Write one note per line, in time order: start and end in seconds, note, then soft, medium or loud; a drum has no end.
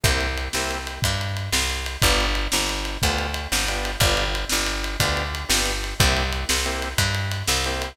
0.04 0.49 C2 medium
0.04 0.27 A#3 loud
0.04 0.27 C4 loud
0.04 0.27 E4 loud
0.04 0.27 G4 loud
0.04 kick loud
0.04 ride loud
0.21 ride medium
0.37 ride medium
0.53 0.99 C2 medium
0.53 0.78 A#3 loud
0.53 0.78 C4 loud
0.53 0.78 E4 loud
0.53 0.78 G4 loud
0.53 snare loud
0.71 ride medium
0.87 ride medium
1.02 1.49 G2 medium
1.02 kick loud
1.02 ride loud
1.21 ride medium
1.37 ride medium
1.52 1.97 C2 medium
1.52 snare loud
1.70 ride medium
1.86 ride medium
2.02 2.48 G1 loud
2.02 2.26 B3 loud
2.02 2.26 D4 loud
2.02 2.26 F4 loud
2.02 2.26 G4 loud
2.02 kick loud
2.02 ride loud
2.20 ride medium
2.35 ride medium
2.52 2.98 G1 medium
2.52 snare loud
2.69 ride medium
2.85 ride medium
3.02 3.47 D2 medium
3.02 3.27 B3 medium
3.02 3.27 D4 medium
3.02 3.27 F4 loud
3.02 3.27 G4 medium
3.02 kick loud
3.02 ride loud
3.18 ride medium
3.34 ride medium
3.52 3.96 G1 medium
3.52 snare loud
3.68 3.91 B3 medium
3.68 3.91 D4 loud
3.68 3.91 F4 medium
3.68 3.91 G4 loud
3.68 ride medium
3.85 ride medium
4.00 4.45 G1 medium
4.00 4.24 B3 loud
4.00 4.24 D4 loud
4.00 4.24 F4 loud
4.00 4.24 G4 loud
4.00 kick loud
4.00 ride loud
4.17 ride medium
4.35 ride medium
4.49 4.97 G1 medium
4.49 snare loud
4.66 ride medium
4.84 ride medium
5.00 5.45 D2 medium
5.00 5.23 B3 medium
5.00 5.23 D4 loud
5.00 5.23 F4 medium
5.00 5.23 G4 loud
5.00 kick loud
5.00 ride loud
5.17 ride medium
5.35 ride medium
5.49 5.94 G1 medium
5.49 5.72 B3 medium
5.49 5.72 D4 medium
5.49 5.72 F4 medium
5.49 5.72 G4 medium
5.49 snare loud
5.65 ride medium
5.84 ride medium
6.00 6.45 C2 medium
6.00 6.23 A#3 loud
6.00 6.23 C4 loud
6.00 6.23 E4 loud
6.00 6.23 G4 loud
6.00 kick loud
6.00 ride loud
6.17 ride medium
6.32 ride medium
6.49 6.94 C2 medium
6.49 snare loud
6.65 6.89 A#3 loud
6.65 6.89 C4 loud
6.65 6.89 E4 medium
6.65 6.89 G4 medium
6.65 ride medium
6.82 ride medium
6.98 7.43 G2 medium
6.98 kick medium
6.98 ride loud
7.15 ride medium
7.31 ride medium
7.47 7.93 C2 medium
7.47 snare loud
7.64 7.89 A#3 medium
7.64 7.89 C4 loud
7.64 7.89 E4 medium
7.64 7.89 G4 loud
7.64 ride medium
7.82 ride medium